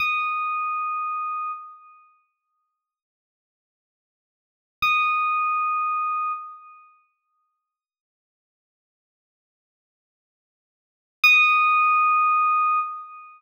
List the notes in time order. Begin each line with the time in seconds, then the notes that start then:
0.00 D#6
4.82 D#6
11.24 D#6